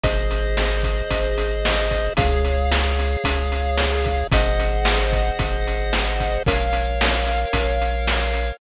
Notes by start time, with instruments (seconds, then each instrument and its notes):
0.04 synth bass 1 G#1, lead 1 (square) G#4 C5 D#5, kick, closed hi-hat
0.31 closed hi-hat
0.57 snare
0.83 kick, closed hi-hat
1.11 synth bass 1 G#1, kick, closed hi-hat
1.38 closed hi-hat
1.65 snare
1.91 kick, closed hi-hat
2.17 synth bass 1 C#2, lead 1 (square) G#4 C#5 F5, kick, closed hi-hat
2.45 closed hi-hat
2.72 snare
2.99 closed hi-hat
3.24 synth bass 1 C#2, kick, closed hi-hat
3.52 closed hi-hat
3.78 snare
4.04 kick, closed hi-hat
4.32 synth bass 1 G#1, lead 1 (square) G#4 C5 D#5 F#5, kick, closed hi-hat
4.60 closed hi-hat
4.85 snare
5.13 kick, closed hi-hat
5.39 synth bass 1 G#1, kick, closed hi-hat
5.67 closed hi-hat
5.93 snare
6.20 kick, closed hi-hat
6.46 synth bass 1 A#1, lead 1 (square) A#4 C#5 F5, kick, closed hi-hat
6.73 closed hi-hat
7.01 snare
7.27 closed hi-hat
7.53 synth bass 1 A#1, kick, closed hi-hat
7.82 closed hi-hat
8.07 snare
8.34 closed hi-hat